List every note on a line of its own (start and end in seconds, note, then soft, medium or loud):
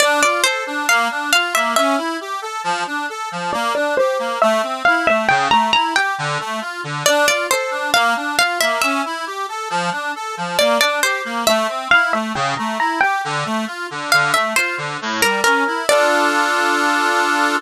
0.00 0.21 D4 loud
0.00 0.19 D5 loud
0.23 0.43 F4 medium
0.23 0.41 D5 medium
0.44 0.64 A4 medium
0.44 0.84 C5 medium
0.67 0.86 D4 medium
0.88 1.08 A#3 loud
0.88 1.27 F5 medium
1.11 1.31 D4 medium
1.33 1.53 F4 medium
1.33 1.53 F5 medium
1.55 1.75 A#3 medium
1.55 1.73 E5 medium
1.76 1.96 C#4 loud
1.76 3.27 E5 loud
1.98 2.17 E4 medium
2.21 2.41 G4 medium
2.42 2.62 A4 medium
2.64 2.84 F3 loud
2.87 3.06 D4 medium
3.09 3.29 A4 medium
3.32 3.51 F3 medium
3.53 3.73 A#3 loud
3.53 3.73 D5 medium
3.75 3.95 D4 medium
3.75 3.95 D5 medium
3.97 4.18 G4 medium
3.97 4.39 C5 medium
4.19 4.39 A#3 medium
4.42 4.62 A3 loud
4.42 4.80 E5 medium
4.63 4.83 C4 medium
4.85 5.06 E4 medium
4.85 5.06 F5 medium
5.07 5.27 A3 medium
5.07 5.27 E5 medium
5.29 5.49 C#3 loud
5.29 5.48 G5 loud
5.51 5.71 A3 medium
5.51 5.71 A#5 medium
5.73 5.94 E4 medium
5.73 5.94 A#5 medium
5.95 6.15 G4 medium
5.95 6.54 G5 medium
6.18 6.38 D3 loud
6.40 6.60 A3 medium
6.61 6.81 F4 medium
6.84 7.03 D3 medium
7.06 7.26 D4 loud
7.06 7.26 D5 loud
7.27 7.47 F4 medium
7.27 7.47 D5 medium
7.50 7.70 A4 medium
7.50 7.91 C5 medium
7.71 7.91 D4 medium
7.94 8.14 A#3 loud
7.94 8.32 F5 medium
8.16 8.36 D4 medium
8.39 8.58 F4 medium
8.39 8.59 F5 medium
8.61 8.81 A#3 medium
8.61 8.79 E5 medium
8.82 9.02 C#4 loud
8.82 10.32 E5 loud
9.05 9.25 E4 medium
9.27 9.46 G4 medium
9.49 9.69 A4 medium
9.70 9.90 F3 loud
9.92 10.12 D4 medium
10.16 10.35 A4 medium
10.37 10.57 F3 medium
10.58 10.78 A#3 loud
10.58 10.79 D5 medium
10.80 11.00 D4 medium
10.80 11.00 D5 medium
11.02 11.22 G4 medium
11.02 11.45 C5 medium
11.25 11.44 A#3 medium
11.47 11.67 A3 loud
11.47 11.86 E5 medium
11.68 11.88 C4 medium
11.91 12.12 E4 medium
11.91 12.12 F5 medium
12.13 12.33 A3 medium
12.13 12.33 E5 medium
12.35 12.55 C#3 loud
12.35 12.54 G5 loud
12.57 12.78 A3 medium
12.57 12.78 A#5 medium
12.79 12.99 E4 medium
12.79 13.01 A#5 medium
13.01 13.22 G4 medium
13.01 13.58 G5 medium
13.24 13.44 D3 loud
13.45 13.65 A3 medium
13.67 13.87 F4 medium
13.91 14.10 D3 medium
14.12 14.33 D3 loud
14.12 14.32 F5 medium
14.34 14.54 A3 medium
14.34 14.55 E5 medium
14.56 14.76 F4 medium
14.56 15.18 C5 medium
14.78 14.97 D3 medium
15.01 15.21 A2 loud
15.21 15.41 G3 medium
15.21 15.41 A#4 medium
15.44 15.64 C#4 medium
15.44 15.82 A#4 medium
15.67 15.87 E4 medium
15.89 17.56 D4 medium
15.89 17.56 F4 loud
15.89 17.56 A4 medium
15.89 17.56 D5 loud